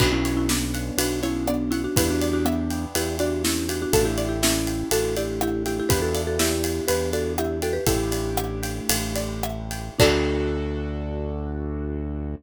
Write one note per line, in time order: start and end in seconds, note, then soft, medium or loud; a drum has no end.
0.00 0.91 B1 medium
0.00 1.93 B3 medium
0.00 1.93 C#4 medium
0.00 0.11 D4 loud
0.00 1.93 D4 medium
0.00 0.11 F#4 loud
0.00 1.93 F#4 medium
0.00 0.98 B4 medium
0.00 kick medium
0.00 crash loud
0.13 0.36 C#4 medium
0.13 0.36 E4 loud
0.25 1.22 C#5 medium
0.25 ride medium
0.37 0.48 C#4 medium
0.37 0.48 E4 loud
0.49 0.96 B3 medium
0.49 0.96 D4 loud
0.49 1.47 D5 medium
0.49 snare medium
0.74 1.72 F#5 medium
0.74 ride medium
0.98 1.88 B1 medium
0.98 1.20 D4 medium
0.98 1.20 F#4 loud
0.98 1.92 B4 medium
0.98 ride loud
1.23 1.46 C#4 medium
1.23 1.46 E4 loud
1.23 1.93 C#5 medium
1.23 ride medium
1.47 1.73 B3 medium
1.47 1.73 D4 medium
1.47 1.94 D5 medium
1.47 cross-stick medium
1.71 1.82 C#4 medium
1.71 1.82 E4 loud
1.71 1.95 F#5 medium
1.71 ride medium
1.84 1.96 D4 medium
1.84 1.96 F#4 loud
1.96 2.86 E2 medium
1.96 3.90 B3 medium
1.96 3.90 D4 medium
1.96 3.90 E4 medium
1.96 2.09 E4 medium
1.96 3.90 G4 medium
1.96 2.09 G4 loud
1.96 2.95 B4 medium
1.96 kick loud
1.96 ride loud
2.10 2.33 D4 medium
2.10 2.33 F#4 loud
2.21 3.19 D5 medium
2.21 ride medium
2.33 2.45 D4 loud
2.33 2.45 F#4 loud
2.45 2.85 B3 medium
2.45 2.85 D4 loud
2.45 3.44 E5 medium
2.45 cross-stick medium
2.70 3.68 G5 medium
2.70 ride medium
2.95 3.86 E2 medium
2.95 3.16 E4 medium
2.95 3.16 G4 loud
2.95 3.89 B4 medium
2.95 ride medium
3.19 3.42 D4 loud
3.19 3.42 F#4 loud
3.19 3.90 D5 medium
3.19 ride medium
3.44 3.67 C#4 medium
3.44 3.67 E4 loud
3.44 3.91 E5 medium
3.44 snare medium
3.69 3.81 D4 medium
3.69 3.81 F#4 loud
3.69 3.92 G5 medium
3.69 ride medium
3.82 3.94 D4 loud
3.82 3.93 F#4 loud
3.93 4.84 A1 medium
3.93 5.87 A3 medium
3.93 5.87 D4 medium
3.93 5.87 E4 medium
3.93 4.05 F#4 medium
3.93 5.87 G4 medium
3.93 4.05 A4 loud
3.93 4.91 A4 medium
3.93 kick medium
3.93 ride medium
4.05 4.28 E4 medium
4.05 4.28 G4 loud
4.18 5.16 D5 medium
4.18 ride medium
4.29 4.40 E4 medium
4.29 4.40 G4 medium
4.43 4.89 C#4 medium
4.43 4.89 E4 loud
4.43 5.41 E5 medium
4.43 snare loud
4.67 5.65 G5 medium
4.67 ride medium
4.91 5.82 A1 medium
4.91 5.15 F#4 loud
4.91 5.15 A4 loud
4.91 5.85 A4 medium
4.91 ride medium
5.16 5.40 E4 medium
5.16 5.40 G4 loud
5.16 5.87 D5 medium
5.16 ride medium
5.41 5.63 E4 medium
5.41 5.63 G4 loud
5.41 5.88 E5 medium
5.41 cross-stick loud
5.66 5.78 E4 medium
5.66 5.78 G4 medium
5.66 5.89 G5 medium
5.66 ride medium
5.80 5.91 E4 medium
5.80 5.88 G4 loud
5.89 6.81 E2 medium
5.89 7.82 B3 medium
5.89 7.82 D4 medium
5.89 7.82 E4 medium
5.89 6.01 G4 loud
5.89 7.82 G4 medium
5.89 6.01 B4 loud
5.89 6.88 B4 medium
5.89 kick loud
5.89 ride medium
6.02 6.22 F#4 medium
6.02 6.22 A4 loud
6.15 7.13 D5 medium
6.15 ride medium
6.27 6.39 F#4 medium
6.27 6.39 A4 loud
6.39 6.85 E4 loud
6.39 6.85 G4 loud
6.39 7.37 E5 medium
6.39 snare medium
6.64 7.62 G5 medium
6.64 ride medium
6.88 7.79 E2 medium
6.88 7.10 G4 medium
6.88 7.10 B4 loud
6.88 7.82 B4 medium
6.88 ride medium
7.13 7.33 F#4 medium
7.13 7.33 A4 loud
7.13 7.83 D5 medium
7.13 ride medium
7.38 7.59 E4 medium
7.38 7.59 G4 loud
7.38 7.85 E5 medium
7.38 cross-stick loud
7.62 7.74 F#4 medium
7.62 7.74 A4 loud
7.62 7.86 G5 medium
7.62 ride medium
7.73 7.85 G4 medium
7.73 7.85 B4 loud
7.86 8.80 A1 medium
7.86 9.94 A3 medium
7.86 9.94 D4 medium
7.86 9.94 E4 medium
7.86 9.50 E4 loud
7.86 9.94 G4 medium
7.86 9.50 G4 loud
7.86 8.89 A4 medium
7.86 kick loud
7.86 ride medium
8.12 9.15 D5 medium
8.12 ride medium
8.37 9.43 E5 medium
8.37 cross-stick loud
8.63 9.70 G5 medium
8.63 ride medium
8.89 9.90 A1 medium
8.89 9.94 A4 medium
8.89 ride loud
9.16 9.95 D5 medium
9.16 ride medium
9.43 9.97 E5 medium
9.43 cross-stick loud
9.71 9.98 G5 medium
9.71 ride medium
9.99 12.35 D2 loud
9.99 12.34 D4 loud
9.99 12.35 D4 medium
9.99 12.35 D4 loud
9.99 12.35 F#4 loud
9.99 12.35 A4 loud
9.99 kick loud
9.99 crash loud